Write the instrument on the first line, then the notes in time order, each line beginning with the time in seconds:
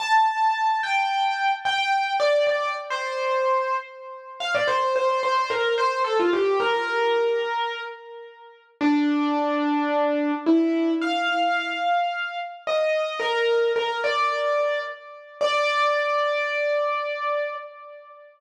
acoustic grand piano
0.00 A5
0.83 G5
1.65 G5
2.20 D5
2.47 D5
2.90 C5
4.40 F5
4.55 D5
4.68 C5
4.96 C5
5.23 C5
5.50 A#4
5.78 C5
6.04 A4
6.19 F4
6.33 G4
6.60 A#4
8.81 D4
10.46 E4
11.01 F5
12.67 D#5
13.19 A#4
13.76 A#4
14.04 D5
15.41 D5